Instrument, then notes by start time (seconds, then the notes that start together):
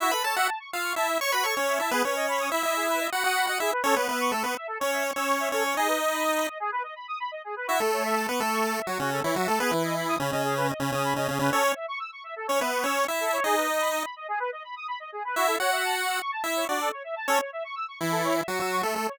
lead 1 (square)
0.00 E4 F#4 E5
0.11 A4 B4 B5
0.24 A4 C#5 A5
0.36 F#4 E5 F#5
0.48 A5
0.60 C#6
0.72 F4 F5 E6
0.83 C#6
0.96 E4 E5 A5
1.08 E5
1.20 C#5 C#6
1.32 F#4 B4 B5
1.44 A4 C#5 C#6
1.56 C#4 C#5
1.67 E5
1.80 E4 E5 A5
1.91 B3 G#4 B4
2.04 C#4 B4 C#5
2.16 D#5
2.28 B5
2.40 D#6
2.52 E4 E5 B5
2.63 E4 D#5 E5
2.76 G#4
2.88 B4
3.00 D#5
3.12 F#4 F#5 B5
3.24 F#4 F#5 D#6
3.36 B5
3.47 F#4 D#5 F#5
3.60 E4 G#4 E5
3.72 B4
3.84 C#4 A4 C#5
3.96 B3 B4 C#5
4.08 B3 B4 E5
4.20 C#6
4.32 A3 A4 E6
4.44 B3 B4 C#6
4.56 E5
4.67 A4
4.80 C#4 C#5
4.93 E5
5.04 C#6
5.16 C#4 C#5 E6
5.28 C#6
5.40 E5
5.52 C#4 A4 C#5
5.64 C#5
5.77 D#4 G#4 D#5
5.88 B4
6.00 D#5
6.12 B5
6.24 D#6
6.36 B5
6.47 D#5
6.60 G#4
6.72 B4
6.83 D#5
6.96 B5
7.08 D#6
7.20 B5
7.31 D#5
7.44 G#4
7.56 B4
7.67 E4 F#4 E5
7.80 A3 A4
7.92 C#5
8.04 E5
8.16 A5
8.28 B3 B4 C#6
8.40 A3 A4 E6
8.52 C#6
8.64 A5
8.76 E5
8.87 F#3 F#4 C#5
8.99 C#3 C#4 F#4
9.12 A4
9.24 E3 E4 C#5
9.36 F#3 F#4 E5
9.48 A3 A4 A5
9.60 B3 G#4 B4
9.71 E3 E4 B4
9.84 D#5
9.96 B5
10.08 D#6
10.20 C#3 C#4 B5
10.31 C#3 C#4 D#5
10.44 G#4
10.56 B4
10.69 D#5
10.80 C#3 C#4 B5
10.92 C#3 C#4 D#6
11.04 B5
11.16 C#3 C#4 D#5
11.28 C#3 C#4 G#4
11.39 C#3 C#4 B4
11.52 C#4 A4 C#5
11.64 C#5
11.75 E5
11.88 C#6
12.00 E6
12.12 C#6
12.24 E5
12.36 A4
12.47 C#4 C#5
12.60 B3 B4 E5
12.72 C#6
12.84 C#4 C#5 E6
12.96 C#6
13.08 E4 E5
13.20 A4
13.33 C#5
13.44 D#4 G#4 D#5
13.56 B4
13.68 D#5
13.80 B5
13.92 D#6
14.04 B5
14.16 D#5
14.28 G#4
14.40 B4
14.52 D#5
14.64 B5
14.76 D#6
14.88 B5
15.00 D#5
15.12 G#4
15.25 B4
15.36 E4 F#4 E5
15.47 A4
15.59 F#4 C#5 F#5
15.72 E5
15.85 A5
15.96 C#6
16.07 E6
16.20 C#6
16.32 A5
16.44 E4 E5
16.56 C#5
16.68 D4 F#4 D5
16.80 A4
16.92 C#5
17.04 E5
17.16 A5
17.28 C#4 A4 C#5
17.40 C#5
17.53 E5
17.64 C#6
17.76 E6
17.88 C#6
18.00 E3 E4 E5
18.12 A4
18.24 C#5
18.36 E5
18.48 F#3 F#4 C#6
18.59 F#3 F#4 E6
18.72 C#6
18.83 A3 A4 E5
18.96 A3 A4
19.08 C#5